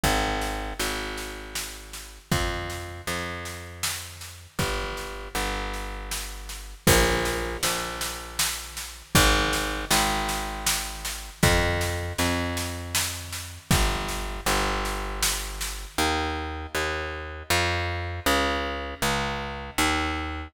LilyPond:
<<
  \new Staff \with { instrumentName = "Electric Bass (finger)" } { \clef bass \time 3/4 \key bes \mixolydian \tempo 4 = 79 aes,,4 aes,,2 | f,4 f,2 | g,,4 g,,2 | bes,,4 bes,,2 |
aes,,4 aes,,2 | f,4 f,2 | g,,4 g,,2 | \key ees \mixolydian ees,4 ees,4 f,4 |
des,4 des,4 ees,4 | }
  \new DrumStaff \with { instrumentName = "Drums" } \drummode { \time 3/4 <bd sn>8 sn8 sn8 sn8 sn8 sn8 | <bd sn>8 sn8 sn8 sn8 sn8 sn8 | <bd sn>8 sn8 sn8 sn8 sn8 sn8 | <cymc bd sn>8 sn8 sn8 sn8 sn8 sn8 |
<bd sn>8 sn8 sn8 sn8 sn8 sn8 | <bd sn>8 sn8 sn8 sn8 sn8 sn8 | <bd sn>8 sn8 sn8 sn8 sn8 sn8 | r4 r4 r4 |
r4 r4 r4 | }
>>